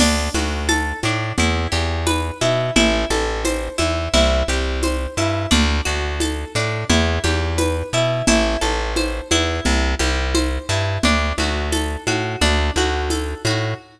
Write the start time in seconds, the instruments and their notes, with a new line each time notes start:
0.00 electric bass (finger) D2, orchestral harp D4, crash, low conga
0.34 electric bass (finger) D2, orchestral harp F#4, high conga
0.69 orchestral harp A4, tambourine, high conga
1.03 electric bass (finger) A2, orchestral harp D4, high conga
1.38 electric bass (finger) E2, orchestral harp E4, low conga
1.72 electric bass (finger) E2, orchestral harp G4
2.07 orchestral harp B4, tambourine, high conga
2.41 electric bass (finger) B2, orchestral harp E4, high conga
2.76 electric bass (finger) A1, orchestral harp E4, low conga
3.10 electric bass (finger) A1, orchestral harp A4, high conga
3.45 orchestral harp C5, tambourine, high conga
3.78 electric bass (finger) E2, orchestral harp E4, high conga
4.14 electric bass (finger) C2, orchestral harp E4, low conga
4.48 electric bass (finger) C2, orchestral harp G4
4.83 orchestral harp C5, tambourine, high conga
5.17 electric bass (finger) G2, orchestral harp E4
5.51 electric bass (finger) D2, orchestral harp D4, low conga
5.85 electric bass (finger) D2, orchestral harp F#4
6.20 orchestral harp A4, tambourine, high conga
6.55 electric bass (finger) A2, orchestral harp D4
6.90 electric bass (finger) E2, orchestral harp E4, low conga
7.24 electric bass (finger) E2, orchestral harp G4, high conga
7.58 orchestral harp B4, tambourine, high conga
7.93 electric bass (finger) B2, orchestral harp E4
8.27 electric bass (finger) A1, orchestral harp E4, low conga
8.61 electric bass (finger) A1, orchestral harp A4, high conga
8.96 orchestral harp C5, tambourine, high conga
9.31 electric bass (finger) E2, orchestral harp E4, high conga
9.65 electric bass (finger) C2, low conga
9.99 electric bass (finger) C2, orchestral harp G4, high conga
10.35 orchestral harp C5, tambourine, high conga
10.69 electric bass (finger) G2, orchestral harp E4
11.03 electric bass (finger) D2, orchestral harp D4, low conga
11.38 electric bass (finger) D2, orchestral harp F#4, high conga
11.72 orchestral harp A4, tambourine, high conga
12.07 electric bass (finger) A2, orchestral harp F#4, high conga
12.41 electric bass (finger) D2, orchestral harp D4, low conga
12.76 electric bass (finger) D2, orchestral harp F#4, high conga
13.10 orchestral harp A4, tambourine, high conga
13.45 electric bass (finger) A2, orchestral harp F#4, high conga